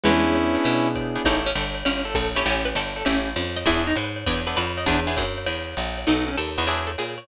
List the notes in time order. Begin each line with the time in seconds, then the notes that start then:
0.03 E2 G#3 B3 C#4 D4 E4 G#4, ride
0.35 hi-hat pedal, ride
0.55 B3 D4 E4 G#4, ride
0.64 B2, ride
0.95 kick, hi-hat pedal, ride
1.16 B3 D4 E4 G#4, ride
1.25 A1 C#4 D#4 E4 G4 A4, kick, ride
1.46 C#4
1.55 G1 A4, hi-hat pedal, ride
1.74 ride
1.85 G1 C#4, ride
2.05 A4
2.15 A#1 A4, kick, hi-hat pedal, ride
2.35 C#4 E4 G4 A4 C#5, ride
2.45 A1 C#4, ride
2.65 B4
2.75 G1 A4, hi-hat pedal, ride
2.96 A4, ride
3.05 A1 C#4 E4 G4 A4, ride
3.36 F2, hi-hat pedal, ride
3.56 D#5, ride
3.66 E2 B3 D4 E4 G#4, kick, ride
3.87 D#4
3.96 G#2 B4, hi-hat pedal, ride
4.16 ride
4.26 E2 B3 D4 E4 G#4, kick, ride
4.47 B3 D4 E4 G#4 B4
4.56 F2 B4, hi-hat pedal, ride
4.77 D#5, ride
4.86 E2 B3 D4 E4 G#4, kick, ride
5.07 B3 D4 E4 G#4
5.17 F#2, kick, hi-hat pedal, ride
5.38 ride
5.46 E2, ride
5.77 A#1, hi-hat pedal, ride
5.98 ride
6.07 B1 B3 D#4 F#4 A4, ride
6.28 C#4
6.37 D#2 A4, hi-hat pedal, ride
6.58 E2 B3 D#4 F#4 A4, ride
6.67 D4 E4 F#4 G#4, ride
6.87 A4
6.98 A#2 G#4, hi-hat pedal, ride
7.18 C#5, ride